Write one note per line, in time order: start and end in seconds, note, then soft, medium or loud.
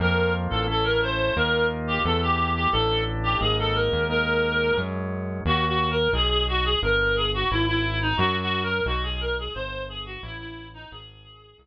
0.00 0.48 F2 loud
0.00 0.67 A#3 medium
0.00 0.67 C4 medium
0.00 0.67 F4 medium
0.00 0.32 A#4 loud
0.50 1.31 A1 medium
0.50 0.65 A4 medium
0.67 1.34 A3 medium
0.67 1.34 C#4 medium
0.67 1.34 E4 medium
0.67 0.84 A4 loud
0.84 1.00 A#4 loud
1.02 1.36 C5 loud
1.36 1.99 D#2 loud
1.36 2.03 A#3 medium
1.36 2.03 D#4 medium
1.36 2.03 F4 medium
1.36 1.66 A#4 loud
1.87 2.01 G4 loud
2.04 2.67 E2 loud
2.04 2.71 A3 medium
2.04 2.71 B3 medium
2.04 2.71 E4 medium
2.04 2.21 A4 medium
2.22 2.51 G4 loud
2.55 2.71 G4 medium
2.72 3.36 A1 loud
2.72 3.40 A3 medium
2.72 3.40 D4 medium
2.72 3.40 E4 medium
2.72 3.01 A4 loud
3.23 3.38 G4 loud
3.40 3.89 G#1 loud
3.40 4.08 G#3 medium
3.40 4.08 A#3 medium
3.40 4.08 D#4 medium
3.40 3.56 G#4 medium
3.59 3.75 A4 loud
3.75 4.03 A#4 medium
3.92 4.72 D#2 loud
4.09 4.76 G#3 medium
4.09 4.76 A#3 medium
4.09 4.76 D#4 medium
4.09 4.78 A#4 loud
4.77 5.40 F#2 medium
4.77 5.44 F#3 medium
4.77 5.44 G#3 medium
4.77 5.44 C#4 medium
5.45 6.08 D#2 loud
5.45 5.65 F#4 loud
5.67 5.90 F#4 loud
5.91 6.10 A#4 loud
6.13 6.76 B1 loud
6.13 6.29 G#4 loud
6.29 6.44 G#4 loud
6.48 6.64 F#4 loud
6.65 6.79 G#4 loud
6.82 7.45 G1 loud
6.82 7.16 A#4 loud
7.16 7.30 G#4 loud
7.34 7.49 F#4 loud
7.50 8.13 G#1 medium
7.50 7.64 E4 loud
7.67 7.99 E4 loud
8.02 8.18 D#4 medium
8.17 8.81 F#2 loud
8.17 8.36 F#4 loud
8.42 8.62 F#4 loud
8.63 8.83 A#4 loud
8.86 9.49 B1 loud
8.86 9.03 F#4 loud
9.03 9.19 G#4 loud
9.21 9.35 A#4 loud
9.38 9.53 G#4 medium
9.54 10.17 G1 loud
9.54 9.83 C5 loud
9.89 10.03 G#4 medium
10.06 10.21 F#4 loud
10.22 10.86 A1 loud
10.22 10.38 E4 loud
10.39 10.67 E4 loud
10.74 10.90 D#4 loud
10.91 11.54 G#1 loud
10.91 11.61 G#4 loud
11.58 11.66 C2 loud